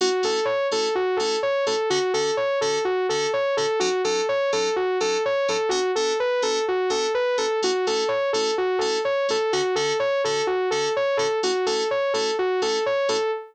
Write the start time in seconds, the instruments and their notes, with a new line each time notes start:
0.01 electric piano 2 A3 C#4 E4 F#4, lead 2 (sawtooth) F#4
0.23 electric piano 2 A3 C#4 E4 F#4, lead 2 (sawtooth) A4
0.45 lead 2 (sawtooth) C#5
0.71 electric piano 2 A3 C#4 E4 F#4, lead 2 (sawtooth) A4
0.95 lead 2 (sawtooth) F#4
1.17 electric piano 2 A3 C#4 E4 F#4, lead 2 (sawtooth) A4
1.43 lead 2 (sawtooth) C#5
1.66 electric piano 2 A3 C#4 E4 F#4, lead 2 (sawtooth) A4
1.90 electric piano 2 D3 C#4 F#4 A4, lead 2 (sawtooth) F#4
2.14 electric piano 2 D3 C#4 F#4 A4, lead 2 (sawtooth) A4
2.37 lead 2 (sawtooth) C#5
2.61 electric piano 2 D3 C#4 F#4 A4, lead 2 (sawtooth) A4
2.85 lead 2 (sawtooth) F#4
3.09 electric piano 2 D3 C#4 F#4 A4, lead 2 (sawtooth) A4
3.33 lead 2 (sawtooth) C#5
3.57 electric piano 2 D3 C#4 F#4 A4, lead 2 (sawtooth) A4
3.80 electric piano 2 F#3 C#4 D#4 A4, lead 2 (sawtooth) F#4
4.04 electric piano 2 F#3 C#4 D#4 A4, lead 2 (sawtooth) A4
4.29 lead 2 (sawtooth) C#5
4.52 electric piano 2 F#3 C#4 D#4 A4, lead 2 (sawtooth) A4
4.76 lead 2 (sawtooth) F#4
5.00 electric piano 2 F#3 C#4 D#4 A4, lead 2 (sawtooth) A4
5.25 lead 2 (sawtooth) C#5
5.48 electric piano 2 F#3 C#4 D#4 A4, lead 2 (sawtooth) A4
5.69 electric piano 2 B3 D4 F#4 A4, lead 2 (sawtooth) F#4
5.95 electric piano 2 B3 D4 F#4 A4, lead 2 (sawtooth) A4
6.20 lead 2 (sawtooth) B4
6.42 electric piano 2 B3 D4 F#4 A4, lead 2 (sawtooth) A4
6.68 lead 2 (sawtooth) F#4
6.90 electric piano 2 B3 D4 F#4 A4, lead 2 (sawtooth) A4
7.14 lead 2 (sawtooth) B4
7.38 electric piano 2 B3 D4 F#4 A4, lead 2 (sawtooth) A4
7.62 electric piano 2 A3 C#4 E4 F#4, lead 2 (sawtooth) F#4
7.87 electric piano 2 A3 C#4 E4 F#4, lead 2 (sawtooth) A4
8.08 lead 2 (sawtooth) C#5
8.33 electric piano 2 A3 C#4 E4 F#4, lead 2 (sawtooth) A4
8.58 lead 2 (sawtooth) F#4
8.79 electric piano 2 A3 C#4 E4 F#4, lead 2 (sawtooth) A4
9.05 lead 2 (sawtooth) C#5
9.29 electric piano 2 A3 C#4 E4 F#4, lead 2 (sawtooth) A4
9.53 electric piano 2 D3 C#4 F#4 A4, lead 2 (sawtooth) F#4
9.75 electric piano 2 D3 C#4 F#4 A4, lead 2 (sawtooth) A4
10.00 lead 2 (sawtooth) C#5
10.24 electric piano 2 D3 C#4 F#4 A4, lead 2 (sawtooth) A4
10.47 lead 2 (sawtooth) F#4
10.71 electric piano 2 D3 C#4 F#4 A4, lead 2 (sawtooth) A4
10.96 lead 2 (sawtooth) C#5
11.17 electric piano 2 D3 C#4 F#4 A4, lead 2 (sawtooth) A4
11.43 electric piano 2 A3 C#4 E4 F#4, lead 2 (sawtooth) F#4
11.66 electric piano 2 A3 C#4 E4 F#4, lead 2 (sawtooth) A4
11.91 lead 2 (sawtooth) C#5
12.14 electric piano 2 A3 C#4 E4 F#4, lead 2 (sawtooth) A4
12.39 lead 2 (sawtooth) F#4
12.62 electric piano 2 A3 C#4 E4 F#4, lead 2 (sawtooth) A4
12.86 lead 2 (sawtooth) C#5
13.09 electric piano 2 A3 C#4 E4 F#4, lead 2 (sawtooth) A4